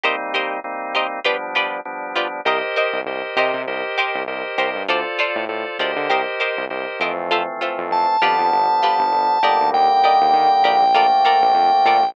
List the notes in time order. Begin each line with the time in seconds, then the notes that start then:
0.04 G3 A#3 C4 D#4 G4 A#4 C5 D#5
0.34 G4 A#4 C5 D#5
0.64 G3 A#3 C4 D#4
0.95 G4 A#4 C5 D#5
1.24 F3 G3 B3 D4 F4 G4 B4 D5
1.55 F4 G4 B4 D5
1.85 F3 G3 B3 D4
2.16 F4 G4 B4 D5
2.45 C2 G4 A#4 C5 D#5
2.76 G4 A#4 C5 D#5
2.93 C2
3.06 C2 G4 A#4 C5 D#5
3.36 C3 G4 A#4 C5 D#5
3.54 C3
3.67 C2 G4 A#4 C5 D#5
3.98 G4 A#4 C5 D#5
4.15 C2
4.27 C2 G4 A#4 C5 D#5
4.58 C2 G4 A#4 C5 D#5
4.75 G2
4.88 D2 F4 A4 C5 D5
5.19 F4 A4 C5 D5
5.36 A2
5.48 A2 F4 A4 C5 D5
5.79 D2 F4 G4 A4 A#4 C5 D5 D#5
5.96 D3
6.09 C2 G4 A#4 C5 D#5
6.40 G4 A#4 C5 D#5
6.57 C2
6.70 C2 G4 A#4 C5 D#5
7.00 F2 E3 F3 A3 C4 G4 A#4 C5 D#5
7.31 F4 A4 C5 E5
7.61 F4 A4 C5 E5
7.78 F2
7.91 F2 A5
8.21 F2 D3 F3 G3 B3 F4 G4 B4 D5
8.39 F2
8.52 G1
8.83 F4 G4 B4 D5
8.99 G1
9.12 G1
9.42 G1 D3 D#3 G3 A#3 G4 A#4 D5 D#5
9.60 D2
9.73 D#2 G5
10.04 G4 A#4 D5 D#5
10.21 D#2
10.33 D#3
10.64 A#1 G4 A#4 D5 D#5
10.94 D3 F3 A3 A#3 F4 A4 A#4 D5
11.25 F4 A4 A#4 D5
11.42 A#1
11.55 F2
11.85 A#2 F4 A4 A#4 D5
12.02 A#1